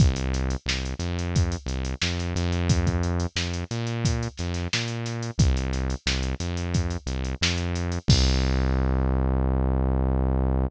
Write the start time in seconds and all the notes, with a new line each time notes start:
0.00 C2, kick, closed hi-hat
0.16 closed hi-hat
0.34 snare, closed hi-hat
0.50 closed hi-hat
0.66 C2, snare
0.85 closed hi-hat
0.99 F2, closed hi-hat
1.19 closed hi-hat
1.36 kick, closed hi-hat
1.52 closed hi-hat
1.66 C2, closed hi-hat
1.85 closed hi-hat
2.02 F2, snare
2.19 snare, closed hi-hat
2.36 F2, closed hi-hat
2.52 closed hi-hat
2.69 kick, closed hi-hat
2.87 kick, closed hi-hat
3.03 closed hi-hat
3.20 closed hi-hat
3.36 F2, snare
3.54 closed hi-hat
3.71 A#2, closed hi-hat
3.87 closed hi-hat
4.05 kick, closed hi-hat
4.23 closed hi-hat
4.37 F2, snare, closed hi-hat
4.54 snare, closed hi-hat
4.73 A#2, snare
4.88 closed hi-hat
5.06 snare, closed hi-hat
5.23 closed hi-hat
5.38 C2, kick, closed hi-hat
5.57 closed hi-hat
5.73 snare, closed hi-hat
5.90 closed hi-hat
6.06 C2, snare
6.23 closed hi-hat
6.40 F2, closed hi-hat
6.57 closed hi-hat
6.74 kick, closed hi-hat
6.90 closed hi-hat
7.06 C2, closed hi-hat
7.25 closed hi-hat
7.41 F2, snare
7.58 closed hi-hat
7.75 closed hi-hat
7.92 closed hi-hat
8.08 C2, kick, crash